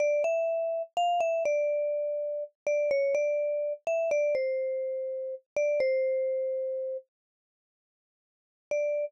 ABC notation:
X:1
M:3/4
L:1/16
Q:1/4=62
K:Dm
V:1 name="Vibraphone"
d e3 f e d5 d | ^c d3 e d =c5 d | c6 z6 | d4 z8 |]